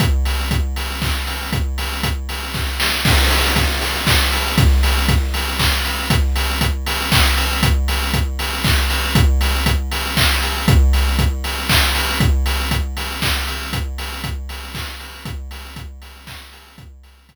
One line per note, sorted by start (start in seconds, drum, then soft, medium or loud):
0.00 kick loud
0.00 closed hi-hat loud
0.25 open hi-hat medium
0.51 kick loud
0.51 closed hi-hat loud
0.76 open hi-hat medium
1.02 kick medium
1.02 clap medium
1.27 open hi-hat medium
1.53 kick loud
1.53 closed hi-hat loud
1.78 open hi-hat medium
2.03 kick medium
2.03 closed hi-hat loud
2.29 open hi-hat medium
2.54 kick medium
2.54 snare medium
2.80 snare loud
3.05 kick loud
3.05 crash loud
3.31 open hi-hat loud
3.56 kick loud
3.56 closed hi-hat loud
3.81 open hi-hat medium
4.07 kick loud
4.07 clap loud
4.32 open hi-hat loud
4.58 kick loud
4.58 closed hi-hat loud
4.83 open hi-hat loud
5.08 kick loud
5.08 closed hi-hat loud
5.34 open hi-hat medium
5.59 kick loud
5.59 clap loud
5.85 open hi-hat medium
6.10 kick loud
6.10 closed hi-hat loud
6.36 open hi-hat loud
6.61 kick loud
6.61 closed hi-hat loud
6.86 open hi-hat loud
7.12 kick loud
7.12 clap loud
7.37 open hi-hat loud
7.63 kick loud
7.63 closed hi-hat loud
7.88 open hi-hat loud
8.14 kick loud
8.14 closed hi-hat loud
8.39 open hi-hat medium
8.64 kick loud
8.64 clap loud
8.90 open hi-hat loud
9.15 kick loud
9.15 closed hi-hat loud
9.41 open hi-hat loud
9.66 kick loud
9.66 closed hi-hat loud
9.92 open hi-hat loud
10.17 kick loud
10.17 clap loud
10.42 open hi-hat medium
10.68 kick loud
10.68 closed hi-hat loud
10.93 open hi-hat medium
11.19 kick loud
11.19 closed hi-hat loud
11.44 open hi-hat medium
11.69 kick loud
11.69 clap loud
11.95 open hi-hat loud
12.20 kick loud
12.20 closed hi-hat loud
12.46 open hi-hat loud
12.71 kick loud
12.71 closed hi-hat loud
12.97 open hi-hat medium
13.22 kick loud
13.22 clap loud
13.47 open hi-hat medium
13.73 kick loud
13.73 closed hi-hat loud
13.98 open hi-hat loud
14.24 kick loud
14.24 closed hi-hat loud
14.49 open hi-hat medium
14.74 kick loud
14.74 clap loud
15.00 open hi-hat medium
15.25 kick loud
15.25 closed hi-hat loud
15.51 open hi-hat loud
15.76 kick loud
15.76 closed hi-hat loud
16.02 open hi-hat medium
16.27 kick loud
16.27 clap loud
16.53 open hi-hat loud
16.78 kick loud
16.78 closed hi-hat loud
17.03 open hi-hat medium
17.29 kick loud
17.29 closed hi-hat loud